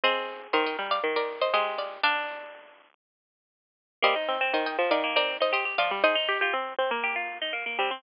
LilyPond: <<
  \new Staff \with { instrumentName = "Pizzicato Strings" } { \time 4/4 \key ees \major \tempo 4 = 120 <c'' ees''>4 <c'' ees''>16 <ees'' g''>8 <d'' f''>16 r16 <bes' d''>8 <c'' ees''>16 <c'' ees''>8 <d'' f''>8 | <d'' f''>1 | <c'' ees''>4 <c'' ees''>16 <ees'' g''>8 <d'' f''>16 r16 <bes' d''>8 <c'' ees''>16 <c'' ees''>8 <d'' f''>8 | <c'' ees''>2. r4 | }
  \new Staff \with { instrumentName = "Pizzicato Strings" } { \time 4/4 \key ees \major aes'4 bes'2 g'4 | d'2~ d'8 r4. | bes16 ees'8 c'16 r4 bes16 c'8 ees'16 g'16 g'16 f'16 r16 | aes'16 ees'8 f'16 r4 g'16 f'8 ees'16 bes16 bes16 c'16 r16 | }
  \new Staff \with { instrumentName = "Pizzicato Strings" } { \time 4/4 \key ees \major c'4 ees8 g8 ees4 aes4 | d'4. r2 r8 | g16 r16 c'16 c'16 ees8 f16 ees4.~ ees16 f16 g16 | ees'16 r16 g'16 g'16 c'8 c'16 bes4.~ bes16 g16 c'16 | }
>>